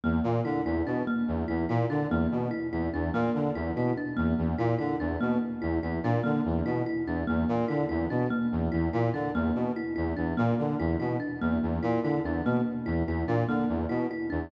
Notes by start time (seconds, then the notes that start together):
0.04 E2 A#3
0.24 A#2
0.45 D3 E4
0.65 E2 E4
0.87 B2 D4
1.07 A#3
1.28 E2
1.48 E2 E4
1.69 A#2 E4
1.90 D3 D4
2.10 E2 A#3
2.31 B2
2.51 E4
2.72 E2 E4
2.93 E2 D4
3.14 A#2 A#3
3.35 D3
3.55 E2 E4
3.76 B2 E4
3.97 D4
4.17 E2 A#3
4.38 E2
4.58 A#2 E4
4.79 D3 E4
5.00 E2 D4
5.21 B2 A#3
5.62 E2 E4
5.83 E2 E4
6.03 A#2 D4
6.24 D3 A#3
6.45 E2
6.66 B2 E4
6.86 E4
7.07 E2 D4
7.27 E2 A#3
7.49 A#2
7.68 D3 E4
7.89 E2 E4
8.10 B2 D4
8.30 A#3
8.52 E2
8.72 E2 E4
8.93 A#2 E4
9.14 D3 D4
9.34 E2 A#3
9.55 B2
9.76 E4
9.96 E2 E4
10.17 E2 D4
10.37 A#2 A#3
10.59 D3
10.79 E2 E4
11.00 B2 E4
11.20 D4
11.41 E2 A#3
11.62 E2
11.83 A#2 E4
12.03 D3 E4
12.24 E2 D4
12.45 B2 A#3
12.86 E2 E4
13.07 E2 E4
13.27 A#2 D4
13.48 D3 A#3
13.69 E2
13.89 B2 E4
14.11 E4
14.30 E2 D4